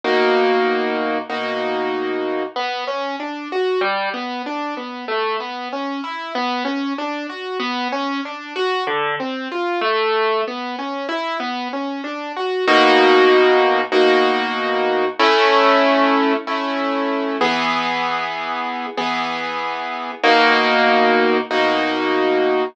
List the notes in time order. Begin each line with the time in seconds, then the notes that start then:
0.04 B2 A#3 D#4 F#4
1.30 B2 A#3 D#4 F#4
2.56 B3
2.87 C#4
3.20 D4
3.52 F#4
3.81 G3
4.14 B3
4.46 D4
4.77 B3
5.08 A3
5.40 B3
5.73 C#4
6.04 E4
6.35 B3
6.65 C#4
6.98 D4
7.29 F#4
7.60 B3
7.92 C#4
8.25 D4
8.56 F#4
8.87 D3
9.20 C4
9.52 F4
9.81 A3
10.48 B3
10.79 C#4
11.09 E4
11.40 B3
11.73 C#4
12.04 D4
12.37 F#4
12.68 B2 A#3 D#4 F#4
13.92 B2 A#3 D#4 F#4
15.19 A3 C#4 E4
16.47 A3 C#4 E4
17.41 E3 B3 G#4
18.98 E3 B3 G#4
20.24 B2 A#3 D#4 F#4
21.51 B2 A#3 D#4 F#4